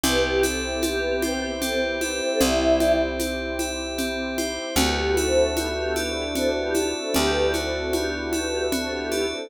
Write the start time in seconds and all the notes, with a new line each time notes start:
0.04 C2 B3 C4 E4 G4, low conga, shaker
0.43 C4 A4 E5, high conga, shaker
0.82 B3 G4, high conga, shaker
1.22 C5, high conga, shaker
1.62 C4 G4 A4, low conga, shaker
1.82 B3 G4
2.01 E5, high conga, shaker
2.22 C4 A4
2.40 C2 G3 E4 C5, low conga, shaker
2.80 G4, high conga, shaker
3.20 G4, high conga, shaker
3.59 E5, high conga, shaker
3.98 G4, low conga, shaker
4.38 C5, high conga, shaker
4.76 D2 B3 D4 E4 F#4 G4 A4, low conga, shaker
5.17 C4 A4 E5, high conga, shaker
5.56 B3 F#4 G4, high conga, shaker
5.96 D5, high conga, shaker
6.35 C4 F#4 A4, low conga, shaker
6.56 B3 G4
6.75 E5, high conga, shaker
6.95 C4 A4
7.14 D2 B3 G4 D5, low conga, shaker
7.54 C4 F#4 A4, high conga, shaker
7.92 B3 F#4 G4, high conga, shaker
8.33 E5, high conga, shaker
8.72 C4 F#4 A4, low conga, shaker
8.92 B3 G4
9.12 D5, high conga, shaker
9.31 C4 A4